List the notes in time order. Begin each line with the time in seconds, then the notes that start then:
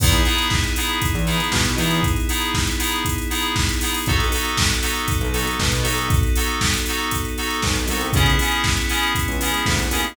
0.00 E2 B3 D#4 E4 G#4, kick, crash
0.12 closed hi-hat
0.25 B3 D#4 E4 G#4, open hi-hat
0.38 closed hi-hat
0.50 kick, snare
0.64 closed hi-hat
0.76 B3 D#4 E4 G#4, open hi-hat
0.89 closed hi-hat
1.02 kick, closed hi-hat
1.15 E2, closed hi-hat
1.26 B3 D#4 E4 G#4, open hi-hat
1.40 closed hi-hat
1.52 B2, kick, snare
1.65 closed hi-hat
1.78 E2 B3 D#4 E4 G#4, open hi-hat
1.91 closed hi-hat
2.03 kick, closed hi-hat
2.16 closed hi-hat
2.29 B3 D#4 E4 G#4, open hi-hat
2.41 closed hi-hat
2.54 kick, snare
2.67 closed hi-hat
2.79 B3 D#4 E4 G#4, open hi-hat
2.92 closed hi-hat
3.05 kick, closed hi-hat
3.18 closed hi-hat
3.30 B3 D#4 E4 G#4, open hi-hat
3.42 closed hi-hat
3.56 kick, snare
3.69 closed hi-hat
3.81 B3 D#4 E4 G#4, open hi-hat
3.94 open hi-hat
4.06 B1 B3 D#4 F#4 A4, kick, closed hi-hat
4.20 closed hi-hat
4.32 B3 D#4 F#4 A4, open hi-hat
4.45 closed hi-hat
4.57 kick, snare
4.70 closed hi-hat
4.82 B3 D#4 F#4 A4, open hi-hat
4.96 closed hi-hat
5.08 kick, closed hi-hat
5.21 B1, closed hi-hat
5.33 B3 D#4 F#4 A4, open hi-hat
5.47 closed hi-hat
5.60 B2, kick, snare
5.72 closed hi-hat
5.83 B1 B3 D#4 F#4 A4, open hi-hat
5.98 closed hi-hat
6.10 kick, closed hi-hat
6.23 closed hi-hat
6.35 B3 D#4 F#4 A4, open hi-hat
6.48 closed hi-hat
6.61 kick, snare
6.74 closed hi-hat
6.86 B3 D#4 F#4 A4, open hi-hat
6.98 closed hi-hat
7.11 kick, closed hi-hat
7.25 closed hi-hat
7.38 B3 D#4 F#4 A4, open hi-hat
7.50 closed hi-hat
7.62 B1, kick, snare
7.76 closed hi-hat
7.88 C2 B3 D#4 F#4 A4, open hi-hat
8.01 closed hi-hat
8.12 C#2 B3 C#4 E4 G#4, kick, closed hi-hat
8.26 closed hi-hat
8.39 B3 C#4 E4 G#4, open hi-hat
8.52 closed hi-hat
8.64 kick, snare
8.77 closed hi-hat
8.89 B3 C#4 E4 G#4, open hi-hat
9.03 closed hi-hat
9.15 kick, closed hi-hat
9.28 C#2, closed hi-hat
9.41 B3 C#4 E4 G#4, open hi-hat
9.54 closed hi-hat
9.66 D2, kick, snare
9.79 closed hi-hat
9.91 D#2 B3 C#4 E4 G#4, open hi-hat
10.04 closed hi-hat